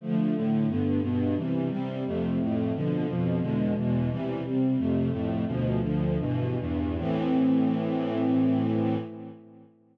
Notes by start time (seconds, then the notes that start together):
0.01 D3 F3 A3
0.36 A2 D3 A3
0.67 G2 D3 B3
1.02 G2 B2 B3
1.36 C3 E3 G3
1.70 C3 G3 C4
2.06 F2 C3 A3
2.39 F2 A2 A3
2.75 B2 D3 F3
3.07 F2 B2 F3
3.40 E2 B2 D3 G#3
3.76 E2 B2 E3 G#3
4.09 C3 E3 G3
4.44 C3 G3 C4
4.77 F2 C3 A3
5.11 F2 A2 A3
5.47 D2 B2 F3
5.81 D2 D3 F3
6.19 G2 B2 E3
6.58 E2 G2 E3
6.98 A2 E3 C4